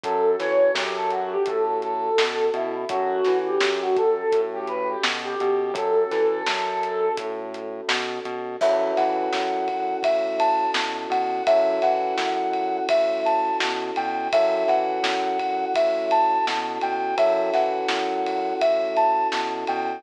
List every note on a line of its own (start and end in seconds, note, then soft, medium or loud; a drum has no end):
0.04 0.36 F#2 loud
0.04 2.85 C#4 medium
0.04 2.85 F#4 medium
0.04 0.38 A4 loud
0.04 2.85 A4 medium
0.04 kick loud
0.04 closed hi-hat loud
0.39 0.71 E3 medium
0.39 0.72 C#5 medium
0.39 snare medium
0.39 closed hi-hat loud
0.74 1.36 F#2 loud
0.74 0.95 G4 loud
0.74 snare loud
0.96 1.10 A4 medium
1.10 1.30 F#4 medium
1.10 closed hi-hat medium
1.32 1.46 G4 medium
1.46 2.10 A2 medium
1.46 1.77 A4 medium
1.46 kick loud
1.46 closed hi-hat loud
1.82 2.46 A4 medium
1.82 closed hi-hat medium
2.18 2.50 B2 loud
2.18 snare loud
2.54 2.85 B2 loud
2.54 2.74 E4 medium
2.54 closed hi-hat medium
2.89 3.21 F#2 loud
2.89 5.70 C#4 medium
2.89 3.38 F#4 loud
2.89 5.70 F#4 medium
2.89 5.70 A4 medium
2.89 kick loud
2.89 closed hi-hat loud
3.25 3.58 E3 medium
3.25 snare medium
3.25 closed hi-hat medium
3.46 3.79 G4 medium
3.60 4.23 F#2 medium
3.60 snare loud
3.82 3.96 F#4 loud
3.96 4.41 A4 loud
3.96 kick loud
3.96 closed hi-hat loud
4.32 4.96 A2 loud
4.32 kick loud
4.32 closed hi-hat loud
4.53 4.67 G4 medium
4.67 4.88 B4 medium
4.67 closed hi-hat medium
4.89 5.03 G4 medium
5.03 5.35 B2 loud
5.03 snare loud
5.24 5.72 G4 medium
5.40 5.72 B2 loud
5.40 closed hi-hat loud
5.74 6.05 F#2 loud
5.74 8.56 C#4 medium
5.74 8.56 F#4 medium
5.74 8.56 A4 medium
5.74 7.12 A4 loud
5.74 kick loud
5.74 closed hi-hat loud
6.11 6.42 E3 medium
6.11 snare medium
6.11 closed hi-hat loud
6.46 7.10 F#2 loud
6.46 snare loud
6.83 closed hi-hat loud
7.17 7.81 A2 loud
7.17 kick loud
7.17 closed hi-hat loud
7.54 closed hi-hat loud
7.88 8.19 B2 loud
7.88 snare loud
8.25 8.56 B2 loud
8.25 closed hi-hat medium
8.61 8.92 F#2 loud
8.61 11.43 C#4 loud
8.61 11.43 E4 medium
8.61 11.43 F#4 loud
8.61 11.43 A4 loud
8.61 8.92 E5 medium
8.61 kick loud
8.61 crash loud
8.97 9.29 E3 medium
8.97 9.97 F#5 medium
8.97 snare medium
8.97 ride medium
9.33 9.95 F#2 medium
9.33 snare loud
9.68 kick medium
9.68 ride medium
10.03 10.67 A2 medium
10.03 10.36 E5 medium
10.03 kick loud
10.03 ride loud
10.40 10.71 A5 medium
10.40 ride loud
10.74 11.06 B2 medium
10.74 snare loud
11.10 11.41 B2 medium
11.10 11.43 F#5 medium
11.10 ride medium
11.47 11.79 F#2 loud
11.47 14.28 C#4 loud
11.47 14.28 E4 loud
11.47 14.28 F#4 loud
11.47 14.28 A4 medium
11.47 11.79 E5 loud
11.47 kick loud
11.47 ride loud
11.82 12.13 E3 medium
11.82 12.77 F#5 medium
11.82 snare medium
11.82 ride medium
12.17 12.80 F#2 medium
12.17 snare loud
12.53 ride medium
12.89 13.51 A2 medium
12.89 13.20 E5 medium
12.89 kick loud
12.89 ride loud
13.25 13.57 A5 medium
13.25 ride medium
13.60 13.91 B2 medium
13.60 snare loud
13.96 14.28 B2 medium
13.96 14.27 G5 medium
13.96 ride medium
14.33 14.64 F#2 loud
14.33 17.14 C#4 medium
14.33 17.14 E4 medium
14.33 17.14 F#4 loud
14.33 17.14 A4 medium
14.33 14.64 E5 loud
14.33 kick loud
14.33 ride loud
14.68 14.99 E3 medium
14.68 15.65 F#5 medium
14.68 snare medium
14.68 ride medium
15.02 15.65 F#2 medium
15.02 snare loud
15.39 kick medium
15.39 ride medium
15.74 16.38 A2 medium
15.74 16.06 E5 medium
15.74 kick loud
15.74 ride loud
16.11 16.45 A5 medium
16.11 ride medium
16.47 16.78 B2 loud
16.47 snare loud
16.81 17.14 B2 medium
16.81 17.16 G5 medium
16.81 ride medium
17.18 17.50 F#2 loud
17.18 19.99 C#4 loud
17.18 19.99 E4 loud
17.18 19.99 F#4 loud
17.18 19.99 A4 loud
17.18 17.51 E5 medium
17.18 kick loud
17.18 ride loud
17.54 17.85 E3 medium
17.54 18.54 F#5 medium
17.54 snare medium
17.54 ride medium
17.89 18.53 F#2 medium
17.89 snare loud
18.26 ride medium
18.61 19.24 A2 medium
18.61 18.93 E5 medium
18.61 kick medium
18.61 ride loud
18.97 19.27 A5 medium
18.97 ride medium
19.32 19.64 B2 medium
19.32 snare loud
19.67 20.00 B2 medium
19.67 20.01 G5 medium
19.67 ride medium